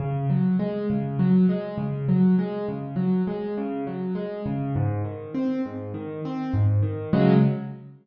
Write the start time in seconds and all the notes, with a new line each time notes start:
0.00 C#3
0.30 F#3
0.59 G#3
0.90 C#3
1.19 F#3
1.49 G#3
1.78 C#3
2.09 F#3
2.39 G#3
2.68 C#3
2.96 F#3
3.27 G#3
3.57 C#3
3.87 F#3
4.15 G#3
4.46 C#3
4.75 G#2
5.04 D#3
5.34 C4
5.65 G#2
5.94 D#3
6.25 C4
6.54 G#2
6.82 D#3
7.13 C#3 F#3 G#3